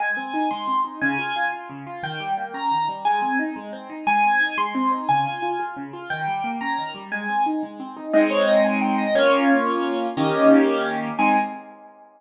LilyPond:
<<
  \new Staff \with { instrumentName = "Acoustic Grand Piano" } { \time 6/8 \key aes \major \tempo 4. = 118 aes''4. c'''4 r8 | aes''4. r4. | g''4. bes''4 r8 | aes''4 r2 |
aes''4. c'''4 r8 | aes''4. r4. | g''4. bes''4 r8 | aes''4 r2 |
ees''8 des''8 ees''8 aes''8 g''8 ees''8 | des''2~ des''8 r8 | ees''4 r2 | aes''4. r4. | }
  \new Staff \with { instrumentName = "Acoustic Grand Piano" } { \time 6/8 \key aes \major aes8 c'8 ees'8 aes8 c'8 ees'8 | des8 f'8 f'8 f'8 des8 f'8 | ees8 g8 bes8 des'8 ees8 g8 | aes8 c'8 ees'8 aes8 c'8 ees'8 |
aes8 c'8 ees'8 aes8 c'8 ees'8 | des8 f'8 f'8 f'8 des8 f'8 | ees8 g8 bes8 des'8 ees8 g8 | aes8 c'8 ees'8 aes8 c'8 ees'8 |
<aes c' ees'>2. | <bes des' f'>2. | <ees bes des' g'>2. | <aes c' ees'>4. r4. | }
>>